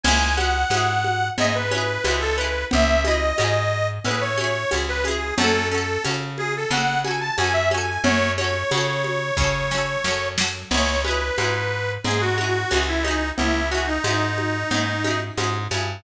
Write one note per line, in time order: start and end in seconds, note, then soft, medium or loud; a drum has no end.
0.03 0.65 C#2 medium
0.03 0.35 C#4 medium
0.03 0.35 G#5 loud
0.03 crash loud
0.03 cowbell loud
0.03 low conga loud
0.08 0.35 E4 medium
0.08 0.35 G#4 medium
0.37 0.68 C#4 medium
0.37 0.68 E4 medium
0.37 1.28 F#5 loud
0.37 high conga medium
0.44 0.68 G#4 medium
0.70 1.30 G#2 medium
0.70 1.32 C#4 medium
0.70 1.32 E4 medium
0.70 tambourine loud
0.70 cowbell medium
0.70 high conga loud
0.77 1.32 G#4 medium
1.04 high conga medium
1.38 1.98 G#2 medium
1.38 1.68 C#4 medium
1.38 1.68 E4 medium
1.38 1.54 D#5 loud
1.38 cowbell loud
1.38 low conga loud
1.44 1.68 G#4 medium
1.55 2.16 B4 loud
1.71 2.02 C#4 medium
1.71 2.02 E4 medium
1.71 high conga medium
1.78 2.02 G#4 medium
2.04 2.65 C#2 medium
2.04 2.35 C#4 medium
2.04 2.35 E4 medium
2.04 tambourine medium
2.04 cowbell medium
2.04 high conga loud
2.11 2.35 G#4 medium
2.20 2.36 A4 loud
2.36 2.99 C#4 medium
2.36 2.65 B4 loud
2.41 2.99 E4 medium
2.41 2.99 G#4 medium
2.71 3.33 C#2 medium
2.71 3.02 E5 loud
2.71 cowbell loud
2.71 low conga loud
3.04 3.35 C#4 medium
3.04 3.35 E4 medium
3.04 3.88 D#5 loud
3.04 high conga loud
3.11 3.35 G#4 medium
3.38 3.99 G#2 medium
3.38 3.99 C#4 medium
3.38 3.99 E4 medium
3.38 tambourine loud
3.38 cowbell medium
3.38 high conga medium
3.44 3.99 G#4 medium
4.04 4.65 A2 medium
4.04 4.35 C#4 medium
4.04 4.35 E4 medium
4.04 4.22 B4 loud
4.04 cowbell medium
4.04 low conga medium
4.11 4.35 G#4 medium
4.21 4.74 C#5 loud
4.38 4.68 C#4 medium
4.38 4.68 E4 medium
4.38 high conga medium
4.44 4.68 G#4 medium
4.71 5.32 C#2 medium
4.71 5.02 C#4 medium
4.71 5.02 E4 medium
4.71 tambourine loud
4.71 cowbell medium
4.71 high conga loud
4.78 5.02 G#4 medium
4.88 5.04 B4 loud
5.04 5.36 C#4 medium
5.04 5.36 E4 medium
5.04 5.34 G#4 medium
5.04 high conga medium
5.11 5.36 G#4 medium
5.38 5.98 F#2 medium
5.38 5.69 C#4 medium
5.38 5.69 F#4 medium
5.38 5.68 A4 loud
5.38 cowbell loud
5.38 low conga loud
5.44 5.69 A4 medium
5.71 6.02 C#4 medium
5.71 6.02 F#4 medium
5.71 6.03 A4 loud
5.78 6.02 A4 medium
6.04 6.65 C#3 medium
6.04 6.66 C#4 medium
6.04 6.66 F#4 medium
6.04 tambourine loud
6.04 cowbell medium
6.04 high conga medium
6.11 6.66 A4 medium
6.38 6.54 G#4 loud
6.38 high conga medium
6.57 6.72 A4 loud
6.71 7.31 C#3 medium
6.71 7.02 C#4 medium
6.71 7.02 F#4 medium
6.71 7.00 F#5 loud
6.71 cowbell medium
6.71 low conga loud
6.77 7.02 A4 medium
7.04 7.35 C#4 medium
7.04 7.35 F#4 medium
7.04 7.20 G#5 medium
7.04 high conga loud
7.11 7.35 A4 medium
7.21 7.36 A5 loud
7.38 7.98 F#2 medium
7.38 7.68 C#4 medium
7.38 7.68 F#4 medium
7.38 7.53 G#5 loud
7.38 tambourine medium
7.38 cowbell loud
7.38 high conga loud
7.44 7.68 A4 medium
7.53 7.69 E5 loud
7.71 8.33 C#4 medium
7.71 8.33 F#4 medium
7.71 8.02 G#5 medium
7.71 high conga medium
7.78 8.33 A4 medium
8.04 8.64 F#2 medium
8.04 8.32 C#5 loud
8.04 cowbell loud
8.04 low conga loud
8.37 8.69 C#4 medium
8.37 8.69 F#4 medium
8.37 10.28 C#5 loud
8.37 high conga medium
8.44 8.69 A4 medium
8.71 9.32 C#3 medium
8.71 9.33 C#4 medium
8.71 9.33 F#4 medium
8.71 tambourine medium
8.71 cowbell medium
8.71 high conga loud
8.78 9.33 A4 medium
9.04 high conga medium
9.37 9.97 C#3 medium
9.37 9.68 C#4 medium
9.37 kick loud
9.37 snare medium
9.41 9.68 F#4 medium
9.41 9.68 A4 medium
9.71 10.02 C#4 medium
9.71 10.02 F#4 medium
9.71 snare loud
9.78 10.02 A4 medium
10.04 10.64 F#2 medium
10.04 10.35 C#4 medium
10.04 10.35 F#4 medium
10.04 snare loud
10.11 10.35 A4 medium
10.38 10.68 C#4 medium
10.38 10.68 F#4 medium
10.38 snare loud
10.44 10.68 A4 medium
10.71 11.31 C#2 medium
10.71 11.02 C#4 medium
10.71 11.02 E4 medium
10.71 11.02 C#5 loud
10.71 crash loud
10.71 cowbell loud
10.71 low conga loud
10.77 11.02 G#4 medium
11.04 11.35 C#4 medium
11.04 11.35 E4 medium
11.04 11.92 B4 loud
11.04 high conga medium
11.11 11.35 G#4 medium
11.38 11.98 G#2 medium
11.38 11.99 C#4 medium
11.38 11.99 E4 medium
11.38 tambourine medium
11.38 cowbell medium
11.38 high conga loud
11.44 11.99 G#4 medium
12.04 12.65 G#2 medium
12.04 12.35 C#4 medium
12.04 12.35 E4 medium
12.04 12.21 G#4 loud
12.04 cowbell medium
12.04 low conga loud
12.11 12.35 G#4 medium
12.20 12.83 F#4 loud
12.38 12.68 C#4 medium
12.38 12.68 E4 medium
12.38 high conga medium
12.44 12.68 G#4 medium
12.71 13.32 C#2 medium
12.71 13.01 C#4 medium
12.71 13.01 E4 medium
12.71 tambourine medium
12.71 cowbell medium
12.71 high conga loud
12.77 13.01 G#4 medium
12.88 13.04 E4 loud
13.02 13.66 C#4 medium
13.02 13.30 D#4 loud
13.02 high conga medium
13.08 13.66 E4 medium
13.08 13.66 G#4 medium
13.37 13.99 C#2 medium
13.37 13.69 E4 loud
13.37 cowbell loud
13.37 low conga loud
13.70 14.02 C#4 medium
13.70 13.86 F#4 loud
13.75 14.02 E4 medium
13.75 14.02 G#4 medium
13.87 15.20 D#4 loud
14.04 14.64 G#2 medium
14.04 14.66 C#4 medium
14.04 14.66 E4 medium
14.04 tambourine medium
14.04 cowbell medium
14.04 high conga medium
14.11 14.66 G#4 medium
14.38 high conga medium
14.71 15.31 G#2 medium
14.71 15.02 C#4 medium
14.71 15.02 E4 medium
14.71 cowbell medium
14.71 low conga loud
14.77 15.02 G#4 medium
15.04 15.35 C#4 medium
15.04 15.35 E4 medium
15.04 high conga medium
15.11 15.35 G#4 medium
15.37 15.68 G#2 medium
15.37 15.68 C#4 medium
15.37 15.68 E4 medium
15.37 tambourine medium
15.37 cowbell medium
15.37 high conga loud
15.44 15.68 G#4 medium
15.71 16.01 G2 medium
15.71 16.02 C#4 medium
15.71 16.02 E4 medium
15.71 high conga medium
15.77 16.02 G#4 medium